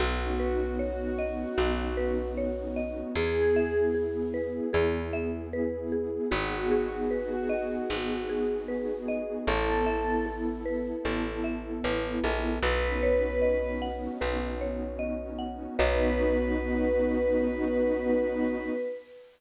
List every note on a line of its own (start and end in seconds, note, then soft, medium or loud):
0.00 1.45 B1 medium
0.00 3.13 B3 medium
0.00 3.13 C#4 medium
0.00 3.13 D#4 medium
0.00 0.70 F#4 medium
0.00 1.57 F#4 loud
0.00 3.13 F#4 medium
0.39 1.97 B4 medium
0.79 2.26 F#4 medium
0.79 2.37 C#5 medium
1.19 2.76 D#5 medium
1.58 3.03 B1 medium
1.58 3.08 F#4 medium
1.97 3.10 B4 medium
2.38 3.13 C#5 medium
2.76 3.14 D#5 medium
3.15 4.61 E2 medium
3.15 6.28 B3 medium
3.15 6.28 E4 medium
3.15 6.28 G#4 medium
3.15 3.80 G#4 medium
3.15 3.94 G#4 medium
3.56 5.13 E5 medium
3.94 4.73 G#4 medium
4.34 5.53 B4 medium
4.73 6.19 E2 medium
4.73 5.92 G#4 medium
5.13 6.26 E5 loud
5.53 6.28 B4 medium
5.92 6.30 G#4 medium
6.31 7.77 G#1 medium
6.31 9.44 B3 medium
6.31 9.44 D#4 medium
6.31 7.89 F#4 medium
6.31 6.99 F#4 medium
6.31 9.44 F#4 medium
6.31 9.44 G#4 medium
6.71 8.29 G#4 medium
7.10 8.42 F#4 medium
7.10 8.68 B4 medium
7.49 9.08 D#5 medium
7.90 9.35 G#1 medium
7.90 9.40 F#4 medium
8.29 9.42 G#4 medium
8.68 9.43 B4 medium
9.08 9.46 D#5 medium
9.47 10.93 A1 medium
9.47 12.61 B3 medium
9.47 12.61 E4 medium
9.47 10.17 A4 medium
9.47 10.26 A4 loud
9.47 12.61 A4 medium
9.86 11.44 E5 medium
10.26 11.05 A4 medium
10.66 11.84 B4 medium
11.05 11.80 A1 medium
11.05 12.24 A4 medium
11.44 12.57 E5 medium
11.84 12.20 A1 medium
11.84 12.59 B4 medium
12.24 12.59 A#1 medium
12.24 12.62 A4 medium
12.63 14.08 B1 medium
12.63 15.77 B3 medium
12.63 15.77 C#4 medium
12.63 15.77 D#4 medium
12.63 15.77 F#4 medium
12.63 13.72 B4 loud
12.63 14.20 B4 medium
13.03 14.61 C#5 medium
13.42 14.99 D#5 medium
13.82 15.38 F#5 medium
14.21 15.67 B1 medium
14.21 15.71 B4 medium
14.61 15.74 C#5 medium
14.99 15.74 D#5 medium
15.39 15.76 F#5 medium
15.78 18.69 B1 loud
15.78 18.69 B3 loud
15.78 18.69 C#4 medium
15.78 18.69 D#4 loud
15.78 18.69 F#4 loud
15.78 18.69 B4 loud
15.78 18.69 C#5 loud
15.78 18.69 D#5 loud